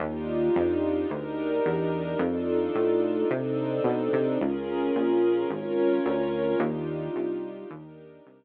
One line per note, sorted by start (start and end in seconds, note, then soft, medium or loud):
0.00 0.49 D#2 loud
0.00 1.10 D4 medium
0.00 1.10 D#4 medium
0.00 1.10 F4 medium
0.00 1.10 G4 medium
0.56 1.06 F2 medium
1.10 1.60 D2 medium
1.10 2.19 D4 medium
1.10 2.19 D#4 medium
1.10 2.19 G4 medium
1.10 2.19 A#4 medium
1.66 2.15 E2 medium
2.19 2.69 F2 loud
2.19 3.29 D4 medium
2.19 3.29 D#4 medium
2.19 3.30 F4 medium
2.19 3.29 A4 medium
2.75 3.25 A2 medium
3.29 3.80 C3 medium
3.29 4.38 C4 medium
3.29 4.38 D4 medium
3.29 4.38 D#4 medium
3.29 4.38 A4 medium
3.84 4.09 B2 medium
4.13 4.38 C3 medium
4.40 4.91 C#2 medium
4.40 5.49 C#4 medium
4.40 5.49 F4 medium
4.40 5.49 G#4 medium
4.40 5.49 A#4 medium
4.96 5.45 A#1 medium
5.50 6.00 G#1 medium
5.50 6.59 C#4 medium
5.50 6.59 F4 medium
5.50 6.59 A#4 medium
5.50 6.59 C#5 medium
6.06 6.55 D2 medium
6.59 7.09 D#2 loud
6.59 7.69 D4 medium
6.59 7.69 D#4 medium
6.59 7.69 F4 medium
6.59 7.69 G4 medium
7.16 7.65 C2 medium
7.70 8.20 D#2 medium
7.70 8.44 D4 medium
7.70 8.44 D#4 medium
7.70 8.44 G4 medium
7.70 8.44 A#4 medium
8.26 8.44 C2 medium